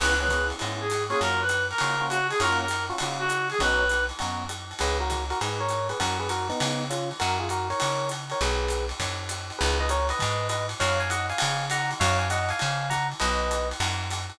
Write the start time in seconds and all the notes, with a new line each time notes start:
0.00 C#2 B3 C#4 E4 G#4 B4, crash, ride
0.20 B3 C#4 E4 G#4 B4
0.28 B3 C#4 E4 G#4, kick, hi-hat pedal, ride
0.50 ride
0.59 G#2 B3 C#4 E4 G#4, ride
0.81 G#4
0.90 hi-hat pedal, ride
1.10 A#3 C#4 F4 F#4 G#4, ride
1.21 F#2 A#4, ride
1.41 B4
1.49 hi-hat pedal, ride
1.70 A#4, ride
1.78 C#3 A#3 C#4 F4 F#4, ride
2.00 A#3 C#4 F4 F#4
2.10 F#4, hi-hat pedal, ride
2.30 G#4, ride
2.40 F#2 A#3 C#4 F4 F#4 A#4, ride
2.61 A#4
2.68 hi-hat pedal, ride
2.89 A#3 C#4 F4 F#4, ride
2.98 C#3 A#3 C#4 F4 F#4, ride
3.19 F#4
3.29 hi-hat pedal, ride
3.50 G#4, ride
3.59 B1 B3 C#4 D#4 F#4 B4, kick, ride
3.89 hi-hat pedal, ride
4.09 ride
4.19 F#2 B3 C#4 D#4 F#4, ride
4.49 hi-hat pedal, ride
4.71 ride
4.79 C#2 G#4 B4, ride
5.00 F#4 A#4
5.10 kick, hi-hat pedal, ride
5.30 F#4 A#4, ride
5.41 G#2 G#4 B4, ride
5.60 A#4 C#5
5.69 hi-hat pedal, ride
5.89 G#4 B4, ride
6.00 F#2 F#4 A#4, kick, ride
6.19 G#4 B4
6.29 F#4 A#4, hi-hat pedal, ride
6.49 B3 D#4, ride
6.60 C#3, ride
6.90 C#4 F4, hi-hat pedal, ride
7.11 ride
7.20 F#2 F#4 A#4, ride
7.40 F4 G#4
7.49 F#4 A#4, hi-hat pedal, ride
7.70 A#4 C#5, ride
7.80 C#3, ride
8.09 hi-hat pedal, ride
8.30 A#4 C#5, ride
8.41 B1 G#4 B4, ride
8.68 hi-hat pedal, ride
8.89 ride
9.00 F#2, kick, ride
9.29 hi-hat pedal, ride
9.50 ride
9.59 C#2 G#4 B4, ride
9.80 B4 D#5
9.89 A#4 C#5, hi-hat pedal, ride
10.09 B4 D#5, ride
10.19 G#2, kick, ride
10.49 B4 D#5, hi-hat pedal, ride
10.69 ride
10.80 F#2 C#5 F5, ride
11.00 F5 G#5
11.10 D#5 F#5, hi-hat pedal, ride
11.30 F5 G#5, ride
11.38 C#3, ride
11.70 F#5 A#5, hi-hat pedal, ride
11.91 ride
12.00 F#2 C#5 F5, kick, ride
12.19 F5 G#5
12.30 D#5 F#5, hi-hat pedal, ride
12.49 F5 G#5, ride
12.59 C#3, ride
12.90 F#5 A#5, kick, hi-hat pedal, ride
13.12 ride
13.20 B1 B4 D#5, ride
13.51 hi-hat pedal, ride
13.71 ride
13.80 F#2, ride
14.11 hi-hat pedal, ride
14.30 ride